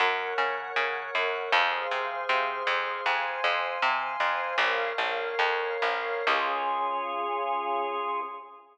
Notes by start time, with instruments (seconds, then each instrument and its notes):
0.00 electric bass (finger) F#2, drawbar organ A#4 C#5 F#5
0.38 electric bass (finger) C#3
0.76 electric bass (finger) C#3
1.15 electric bass (finger) F#2
1.52 electric bass (finger) F2, drawbar organ G#4 C5 F5
1.91 electric bass (finger) C3
2.29 electric bass (finger) C3
2.67 electric bass (finger) F2
3.06 electric bass (finger) F2, drawbar organ C5 F5 G#5
3.44 electric bass (finger) F2
3.82 electric bass (finger) C3
4.20 electric bass (finger) F2
4.58 electric bass (finger) A#1, drawbar organ A#4 C#5 F5
4.98 electric bass (finger) A#1
5.39 electric bass (finger) F2
5.82 electric bass (finger) A#1
6.27 electric bass (finger) C#2, drawbar organ C#4 F4 G#4